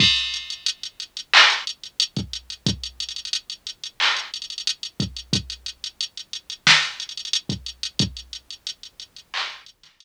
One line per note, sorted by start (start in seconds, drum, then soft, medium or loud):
0.00 kick medium
0.00 crash loud
0.16 closed hi-hat medium
0.34 closed hi-hat medium
0.50 closed hi-hat medium
0.66 closed hi-hat loud
0.83 closed hi-hat medium
1.00 closed hi-hat medium
1.17 closed hi-hat medium
1.34 clap loud
1.50 closed hi-hat medium
1.67 closed hi-hat medium
1.83 closed hi-hat medium
2.00 closed hi-hat loud
2.17 kick medium
2.17 closed hi-hat medium
2.33 closed hi-hat medium
2.50 closed hi-hat medium
2.67 kick loud
2.67 closed hi-hat medium
2.83 closed hi-hat medium
3.00 closed hi-hat medium
3.09 closed hi-hat medium
3.16 closed hi-hat medium
3.25 closed hi-hat medium
3.33 closed hi-hat loud
3.50 closed hi-hat medium
3.67 closed hi-hat medium
3.84 closed hi-hat medium
4.00 clap medium
4.17 closed hi-hat medium
4.34 closed hi-hat medium
4.42 closed hi-hat medium
4.50 closed hi-hat medium
4.58 closed hi-hat medium
4.67 closed hi-hat loud
4.83 closed hi-hat medium
5.00 kick medium
5.00 closed hi-hat medium
5.17 closed hi-hat medium
5.33 kick medium
5.33 closed hi-hat loud
5.50 closed hi-hat medium
5.66 closed hi-hat medium
5.84 closed hi-hat medium
6.01 closed hi-hat medium
6.17 closed hi-hat medium
6.33 closed hi-hat medium
6.50 closed hi-hat medium
6.67 snare loud
6.83 closed hi-hat medium
7.00 closed hi-hat medium
7.09 closed hi-hat medium
7.17 closed hi-hat medium
7.25 closed hi-hat medium
7.33 closed hi-hat loud
7.49 kick medium
7.49 closed hi-hat medium
7.66 closed hi-hat medium
7.83 closed hi-hat medium
7.99 kick loud
7.99 closed hi-hat loud
8.17 closed hi-hat medium
8.33 closed hi-hat medium
8.50 closed hi-hat medium
8.67 closed hi-hat medium
8.83 closed hi-hat medium
9.00 closed hi-hat medium
9.16 closed hi-hat medium
9.34 clap loud
9.50 closed hi-hat medium
9.66 closed hi-hat medium
9.83 snare soft
9.83 closed hi-hat medium
10.00 closed hi-hat loud